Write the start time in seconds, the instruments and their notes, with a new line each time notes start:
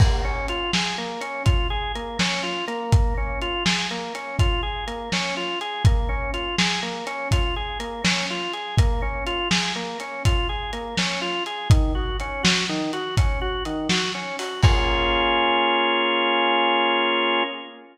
0.00 drawbar organ A#3, kick, crash
0.24 drawbar organ C#4
0.48 drawbar organ F4, closed hi-hat
0.73 drawbar organ G#4, snare
0.98 drawbar organ A#3
1.21 drawbar organ C#4, closed hi-hat
1.45 drawbar organ F4, kick, closed hi-hat
1.70 drawbar organ G#4
1.95 drawbar organ A#3, closed hi-hat
2.19 drawbar organ C#4, snare
2.43 drawbar organ F4
2.67 drawbar organ A#3, closed hi-hat
2.92 kick, closed hi-hat
3.17 drawbar organ C#4
3.41 drawbar organ F4, closed hi-hat
3.65 drawbar organ G#4, snare
3.91 drawbar organ A#3
4.15 drawbar organ C#4, closed hi-hat
4.39 drawbar organ F4, kick, closed hi-hat
4.63 drawbar organ G#4
4.87 drawbar organ A#3, closed hi-hat
5.12 drawbar organ C#4, snare
5.37 drawbar organ F4
5.61 drawbar organ G#4, closed hi-hat
5.85 drawbar organ A#3, kick, closed hi-hat
6.09 drawbar organ C#4
6.34 drawbar organ F4, closed hi-hat
6.58 drawbar organ G#4, snare
6.83 drawbar organ A#3
7.07 drawbar organ C#4, closed hi-hat
7.31 drawbar organ F4, kick, closed hi-hat
7.56 drawbar organ G#4
7.80 drawbar organ A#3, closed hi-hat
8.04 drawbar organ C#4, snare
8.30 drawbar organ F4
8.53 drawbar organ G#4, closed hi-hat
8.78 drawbar organ A#3, kick, closed hi-hat
9.02 drawbar organ C#4
9.26 drawbar organ F4, closed hi-hat
9.51 drawbar organ G#4, snare
9.76 drawbar organ A#3
10.00 drawbar organ C#4, closed hi-hat
10.25 drawbar organ F4, kick, closed hi-hat
10.49 drawbar organ G#4
10.73 drawbar organ A#3, closed hi-hat
10.97 drawbar organ C#4, snare
11.21 drawbar organ F4
11.46 drawbar organ G#4, closed hi-hat
11.70 drawbar organ D#3, kick, closed hi-hat
11.95 drawbar organ F#4
12.20 drawbar organ C#4, closed hi-hat
12.43 drawbar organ F#4, snare
12.69 drawbar organ D#3
12.93 drawbar organ F#4, closed hi-hat
13.17 drawbar organ C#4, kick, closed hi-hat
13.41 drawbar organ F#4
13.65 drawbar organ D#3, closed hi-hat
13.89 drawbar organ F#4, snare
14.15 drawbar organ C#4
14.39 drawbar organ F#4, open hi-hat
14.63 drawbar organ A#3 C#4 F4 G#4, kick, crash